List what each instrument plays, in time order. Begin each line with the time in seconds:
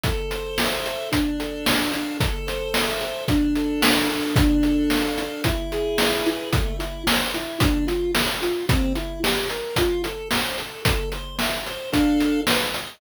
0.03 lead 1 (square) A4, kick, closed hi-hat
0.31 lead 1 (square) C5, closed hi-hat
0.58 lead 1 (square) E5, snare
0.86 lead 1 (square) A4, closed hi-hat
1.12 lead 1 (square) D4, kick, closed hi-hat
1.40 lead 1 (square) A4, closed hi-hat
1.65 lead 1 (square) F5, snare
1.92 lead 1 (square) D4, closed hi-hat
2.20 lead 1 (square) A4, kick, closed hi-hat
2.47 lead 1 (square) C5, closed hi-hat
2.74 lead 1 (square) E5, snare
3.01 lead 1 (square) A4, closed hi-hat
3.28 lead 1 (square) D4, kick, closed hi-hat
3.56 lead 1 (square) A4, closed hi-hat
3.81 lead 1 (square) F5, snare
4.09 lead 1 (square) D4, open hi-hat
4.36 lead 1 (square) D4, kick, closed hi-hat
4.63 lead 1 (square) A4, closed hi-hat
4.90 lead 1 (square) F5, snare
5.18 lead 1 (square) D4, closed hi-hat
5.44 lead 1 (square) E4, kick, closed hi-hat
5.72 lead 1 (square) G#4, closed hi-hat
5.98 lead 1 (square) B4, snare
6.26 lead 1 (square) E4, closed hi-hat
6.52 lead 1 (square) A3, kick, closed hi-hat
6.79 lead 1 (square) E4, closed hi-hat
7.07 lead 1 (square) C5, snare
7.34 lead 1 (square) E4, closed hi-hat
7.60 lead 1 (square) D4, kick, closed hi-hat
7.87 lead 1 (square) F4, closed hi-hat
8.15 lead 1 (square) A4, snare
8.42 lead 1 (square) F4, closed hi-hat
8.69 lead 1 (square) C4, kick, closed hi-hat
8.95 lead 1 (square) E4, closed hi-hat
9.23 lead 1 (square) G4, snare
9.50 lead 1 (square) A#4, closed hi-hat
9.76 lead 1 (square) F4, kick, closed hi-hat
10.04 lead 1 (square) A4, closed hi-hat
10.31 lead 1 (square) C5, snare
10.58 lead 1 (square) A4, closed hi-hat
10.85 lead 1 (square) A4, kick, closed hi-hat
11.12 lead 1 (square) C5, closed hi-hat
11.39 lead 1 (square) E5, snare
11.66 lead 1 (square) C5, closed hi-hat
11.92 lead 1 (square) D4 A4 F5, kick, closed hi-hat
12.20 closed hi-hat
12.47 lead 1 (square) B4, snare
12.74 lead 1 (square) D#5, closed hi-hat